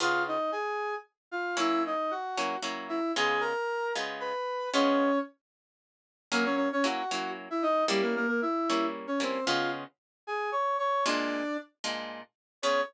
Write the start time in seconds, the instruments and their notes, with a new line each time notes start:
0.00 acoustic guitar (steel) C#3 B3 F4 G#4, brass section F4 F5
0.28 brass section D#4 D#5
0.52 brass section G#4 G#5
1.31 brass section F4 F5
1.57 acoustic guitar (steel) F#3 A#3 C#4 E4, brass section E4 E5
1.86 brass section D#4 D#5
2.11 brass section F#4 F#5
2.38 acoustic guitar (steel) F#3 A#3 C#4 E4
2.63 acoustic guitar (steel) F#3 A#3 C#4 E4
2.89 brass section E4 E5
3.16 acoustic guitar (steel) C#3 G#3 B3 F4, brass section G#4 G#5
3.41 brass section A#4 A#5
3.96 acoustic guitar (steel) C#3 G#3 B3 F4
4.20 brass section B4 B5
4.74 acoustic guitar (steel) C#3 G#3 B3 F4, brass section C#4 C#5
6.32 acoustic guitar (steel) F#3 A#3 C#4 E4, brass section A#3 A#4
6.45 brass section C#4 C#5
6.56 brass section C#4 C#5
6.72 brass section C#4 C#5
6.84 acoustic guitar (steel) F#3 A#3 C#4 E4, brass section F#4 F#5
7.11 acoustic guitar (steel) F#3 A#3 C#4 E4
7.50 brass section E4 E5
7.62 brass section D#4 D#5
7.88 acoustic guitar (steel) G3 A#3 C#4 E4, brass section G3 G4
8.02 brass section A#3 A#4
8.16 brass section A#3 A#4
8.28 brass section A#3 A#4
8.42 brass section E4 E5
8.70 acoustic guitar (steel) G3 A#3 C#4 E4
9.07 brass section C#4 C#5
9.20 acoustic guitar (steel) G3 A#3 C#4 E4, brass section C4 C5
9.46 acoustic guitar (steel) C#3 G#3 B3 F4, brass section F4 F5
10.27 brass section G#4 G#5
10.52 brass section C#5 C#6
10.78 brass section C#5 C#6
11.06 acoustic guitar (steel) A#2 G#3 D4 F4, brass section D4 D5
11.84 acoustic guitar (steel) A#2 G#3 D4 F4
12.63 acoustic guitar (steel) C#3 B3 F4 G#4, brass section C#5